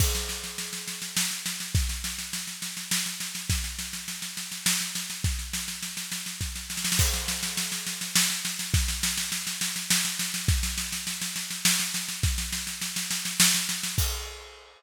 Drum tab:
CC |x-----------------------|------------------------|------------------------|------------------------|
SD |o-o-o-o-o-o-o-o-o-o-o-o-|o-o-o-o-o-o-o-o-o-o-o-o-|o-o-o-o-o-o-o-o-o-o-o-o-|o-o-o-o-o-o-o-o-o-o-oooo|
BD |o-----------------------|o-----------------------|o-----------------------|o---------------o-------|

CC |x-----------------------|------------------------|------------------------|------------------------|
SD |o-o-o-o-o-o-o-o-o-o-o-o-|o-o-o-o-o-o-o-o-o-o-o-o-|o-o-o-o-o-o-o-o-o-o-o-o-|o-o-o-o-o-o-o-o-o-o-o-o-|
BD |o-----------------------|o-----------------------|o-----------------------|o-----------------------|

CC |x-----------------------|
SD |------------------------|
BD |o-----------------------|